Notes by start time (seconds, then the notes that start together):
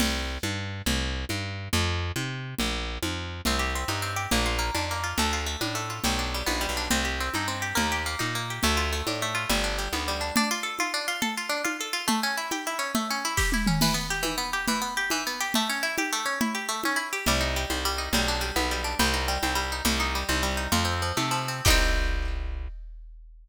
0.00 C2, crash, low conga
0.43 G2, high conga
0.86 C2, low conga
1.29 G2, high conga
1.73 F2, low conga
2.16 C3, high conga
2.59 A#1, low conga
3.03 F2, high conga
3.45 C2 C4, low conga
3.59 G4
3.75 C4
3.88 G2 D#4, high conga
4.02 C4
4.16 G4
4.31 A#1 A#3, low conga
4.46 F4
4.59 A#3
4.75 F2 D4, high conga
4.91 A#3
5.04 F4
5.18 D2 A3, low conga
5.33 F4
5.46 A3
5.61 A2 D4, high conga
5.75 A3
5.90 F4
6.04 B1 G3, low conga
6.19 D4
6.34 G3
6.46 A#1 B3, high conga
6.61 G3
6.69 B1
6.77 D4
6.90 C2 C4, low conga
7.05 G4
7.20 C4
7.34 G2 D#4, high conga
7.48 C4
7.62 G4
7.75 D#2 A#3, low conga
7.92 G4
8.06 A#3
8.19 A#2 D#4, high conga
8.35 A#3
8.50 G4
8.63 D2 A3, low conga
8.77 F4
8.93 A3
9.07 A2 D4, high conga
9.22 A3
9.35 F4
9.50 G1 G3, low conga
9.64 D4
9.78 G3
9.93 D2 B3, high conga
10.08 G3
10.21 D4
10.36 D4, low conga
10.51 F4
10.63 A4
10.79 F4, high conga
10.94 D4
11.08 F4
11.22 A4, low conga
11.37 F4
11.49 D4
11.65 F4, high conga
11.81 A4
11.93 F4
12.08 A3, low conga
12.23 C#4
12.37 E4
12.51 G4, high conga
12.67 E4
12.79 C#4
12.95 A3, low conga
13.10 C#4
13.25 E4
13.37 G4, kick, snare
13.52 E4, high tom
13.67 C#4, mid tom
13.81 E3, crash, low conga
13.94 B3
14.10 G4
14.23 E3, high conga
14.38 B3
14.53 G4
14.68 E3, low conga
14.82 B3
14.97 G4
15.10 E3, high conga
15.27 B3
15.41 G4
15.54 A3, low conga
15.69 C#4
15.83 E4
15.98 G4, high conga
16.13 A3
16.26 C#4
16.41 E4, low conga
16.55 G4
16.69 A3
16.84 C#4, high conga
16.96 E4
17.13 G4
17.26 C2 G3, low conga
17.41 D#4
17.56 G3
17.70 C2 C4, high conga
17.85 G3
17.98 D#4
18.13 B1 G3, low conga
18.28 D4
18.41 G3
18.56 B1 B3, high conga
18.71 G3
18.84 D4
18.99 C2 G3, low conga
19.14 D#4
19.28 G3
19.43 C2 C4, high conga
19.55 G3
19.72 D#4
19.85 C2 G3, low conga
20.00 D#4
20.15 G3
20.29 C2 C4, high conga
20.43 G3
20.57 D#4
20.72 F2 F3, low conga
20.85 C4
21.02 F3
21.17 C3 A3, high conga
21.31 F3
21.48 C4
21.65 C2 D#4 G4, kick, crash
21.70 C4